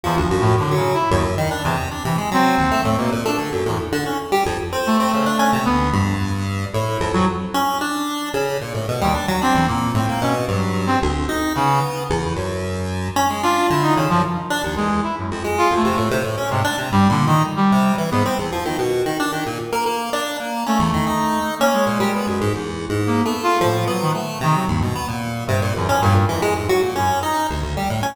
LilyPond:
<<
  \new Staff \with { instrumentName = "Brass Section" } { \time 7/8 \tempo 4 = 112 \tuplet 3/2 { e,8 f8 a,8 d8 des8 e'8 } ees,16 r8. e,16 r16 | r16 e16 r16 c'4 a16 bes16 r16 d'16 r8 e,16 | r2 a4. | b8 f,8 r4 e'8. ges16 r8 |
r2 r8. ees,16 r8 | c'8 bes8 c'8 des'16 r16 ges8. c'16 r8 | r8 des8 r2 r8 | r8 f'8 e'16 ees'16 ees16 f16 r4 aes8 |
e'16 ges,16 r8 \tuplet 3/2 { f'8 a8 a8 } r8. c16 r8 | \tuplet 3/2 { g8 d8 ees8 } r16 g8. r16 b16 r4 | r2. r8 | a4. r16 bes16 aes4. |
r4 \tuplet 3/2 { bes8 b8 f'8 } a,8 ges16 ees16 r8 | ees16 ges16 g,8 r4 g,8 ges,16 f,16 g,8 | f,8 r8. ges,16 r2 | }
  \new Staff \with { instrumentName = "Lead 1 (square)" } { \time 7/8 f16 d,16 ges,8 a,16 ges8 r16 ges,8 ees16 d'16 c8 | d'16 c16 aes16 ges8 ees,16 a16 a,16 b,16 bes,16 a16 d16 ges,16 a,16 | r16 d16 des'16 r16 g16 f,16 r16 c'8 c'16 des16 d'16 des'16 c16 | d,8 g,4. a,8 f,16 f,16 r8 |
des'8 d'4 des8 bes,16 a,16 b,16 g16 d'16 ges16 | d'16 e,16 bes,8 a,16 bes16 b,8 g,4 d,8 | ees'8 b4 e,8 ges,4. | des'16 aes16 d'8 d8 des16 ges,16 r8 d'16 ees,16 e,8 |
r8 f,16 aes8 f,16 c16 a,16 c16 a,16 des'16 aes,16 d'16 c16 | \tuplet 3/2 { g,8 bes,8 ees'8 } r8 c8 e16 aes,16 c'16 e,16 f16 ees16 | b,8 ees16 d'16 ees16 bes,16 r16 bes16 bes8 d'8 bes8 | des'16 e,16 ees16 ees'4 des'8 bes,16 g16 b16 ges,16 aes,16 |
\tuplet 3/2 { e,4 aes,4 a4 } f8 b8 a8 | c8 ees,16 b,16 b16 bes,8. c16 bes,16 e,16 des'16 bes,16 r16 | e16 aes16 aes,16 ges16 bes,16 des'8 ees'8 d,16 d,16 g16 a,16 des'16 | }
>>